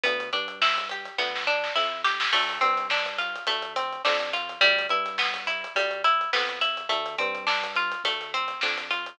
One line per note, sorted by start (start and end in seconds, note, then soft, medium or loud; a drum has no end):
0.03 0.30 D2 loud
0.03 0.30 B3 medium
0.03 kick loud
0.03 closed hi-hat medium
0.20 closed hi-hat medium
0.33 1.08 G2 medium
0.33 0.59 D4 medium
0.33 kick medium
0.33 closed hi-hat medium
0.48 closed hi-hat medium
0.62 0.88 E4 medium
0.62 snare loud
0.78 kick medium
0.78 closed hi-hat medium
0.89 1.17 G4 medium
0.89 closed hi-hat medium
1.05 closed hi-hat medium
1.18 1.69 D2 medium
1.18 1.44 B3 medium
1.18 kick medium
1.18 snare medium
1.35 snare medium
1.47 1.73 D4 medium
1.64 snare medium
1.75 2.26 F2 medium
1.75 2.02 E4 medium
1.75 snare medium
2.04 2.30 G4 medium
2.04 snare medium
2.20 snare loud
2.33 2.59 D2 loud
2.33 2.59 A3 medium
2.33 kick loud
2.33 crash medium
2.49 closed hi-hat medium
2.61 3.36 G2 medium
2.61 2.87 C4 medium
2.61 kick medium
2.61 closed hi-hat medium
2.78 closed hi-hat medium
2.90 3.17 D4 medium
2.90 snare loud
3.06 kick medium
3.06 closed hi-hat medium
3.18 3.45 F4 medium
3.18 snare soft
3.18 closed hi-hat medium
3.36 closed hi-hat medium
3.47 3.98 D2 medium
3.47 3.73 A3 medium
3.47 kick medium
3.47 closed hi-hat loud
3.62 closed hi-hat medium
3.76 4.02 C4 medium
3.76 closed hi-hat medium
3.93 closed hi-hat medium
4.05 4.55 F2 loud
4.05 4.31 D4 medium
4.05 snare loud
4.20 closed hi-hat medium
4.33 4.59 F4 medium
4.33 closed hi-hat medium
4.49 closed hi-hat medium
4.61 4.87 D2 loud
4.61 4.87 G3 loud
4.61 kick loud
4.61 closed hi-hat medium
4.79 closed hi-hat medium
4.89 5.65 G2 medium
4.89 5.16 E4 medium
4.89 kick medium
4.89 closed hi-hat medium
5.06 snare soft
5.06 closed hi-hat medium
5.18 5.45 B3 medium
5.18 snare loud
5.34 kick medium
5.34 snare soft
5.34 closed hi-hat medium
5.47 5.73 E4 medium
5.47 closed hi-hat medium
5.64 closed hi-hat medium
5.75 6.26 D2 medium
5.75 6.02 G3 medium
5.75 kick medium
5.75 closed hi-hat loud
5.91 closed hi-hat medium
6.04 6.30 E4 medium
6.04 closed hi-hat medium
6.21 closed hi-hat medium
6.33 6.84 F2 medium
6.33 6.59 B3 medium
6.33 snare loud
6.49 closed hi-hat medium
6.61 6.87 E4 medium
6.61 closed hi-hat medium
6.77 closed hi-hat medium
6.89 7.16 D2 loud
6.89 7.15 A3 medium
6.89 kick loud
6.89 closed hi-hat medium
7.06 closed hi-hat medium
7.18 7.94 G2 loud
7.18 7.45 C4 medium
7.18 kick medium
7.18 closed hi-hat medium
7.35 closed hi-hat medium
7.47 7.73 D4 medium
7.47 snare loud
7.63 kick medium
7.63 closed hi-hat medium
7.76 8.03 F4 medium
7.76 closed hi-hat medium
7.92 closed hi-hat medium
8.04 8.55 D2 medium
8.04 8.31 A3 medium
8.04 kick medium
8.04 closed hi-hat loud
8.21 snare soft
8.21 closed hi-hat medium
8.34 8.60 C4 medium
8.34 closed hi-hat medium
8.48 snare soft
8.48 closed hi-hat medium
8.61 9.12 F2 medium
8.61 8.89 D4 medium
8.61 snare loud
8.78 closed hi-hat medium
8.91 9.17 F4 medium
8.91 closed hi-hat medium
9.06 closed hi-hat medium